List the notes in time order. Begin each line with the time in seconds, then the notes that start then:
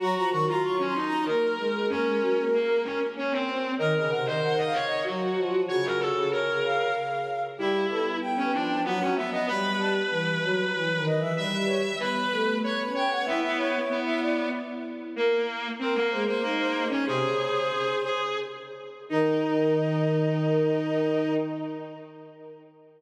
0.00 F#3 F#4 A#5
0.15 F3 A#5
0.30 D#3 F#4 C#6
0.47 F#3 F4 A#5
0.63 C#6
0.79 C#4
0.85 C6
0.95 D#4
1.05 A#5
1.25 A#3 A#4
1.58 G#3
1.88 A#3 C#4 A#4
2.06 G#3
2.20 F#3
2.37 A#3
2.53 A#3
2.84 C#4
3.16 C#4
3.31 C4
3.48 C4
3.78 D#3 A#4 D#5
3.96 C#3 D#5
4.10 C3 A#4 F#5
4.25 D#3 C5 D#5
4.43 F#5
4.58 D#5
4.64 F5
4.73 C#5
4.86 D#5
5.04 F#3 F#4
5.38 F3
5.68 C#3 F#4 C#5
5.85 A#4
6.00 A4
6.15 C#3
6.31 A#4 C#5
6.48 C#3
6.64 F5
7.58 G3 E4 G4
7.89 B3 A4
8.22 G5
8.37 C#4
8.53 F3 D4
8.84 F#3 B3 F#5
9.01 C#4
9.15 B3 E5
9.31 B3 D#5
9.46 G3 B4 B5
9.79 A5
10.09 E3 B4
10.43 F#3
10.74 E3 B4
10.95 D#3
11.06 D#5
11.16 E3 E5
11.35 G3 B4 E5
11.67 C#5
11.99 B3 B4 B5
12.31 A3
12.63 B3 C#5 B5
12.86 C#4
12.94 C#5 G5
13.05 B3
13.11 F#5
13.25 B3 E4 E5
13.42 E4 E5
13.58 C#5
13.73 E4
13.90 B3
14.05 E5
14.21 D5
15.16 A#3
15.79 A#3 C4 A#4
15.95 A#3
16.10 G#3 C5
16.26 A#3 C5
16.42 A#3 D#4
16.58 C5
16.89 C#4 C#5
17.05 C3 G#4 C5
17.21 C#3
18.04 G#4
19.09 D#3 D#4 D#5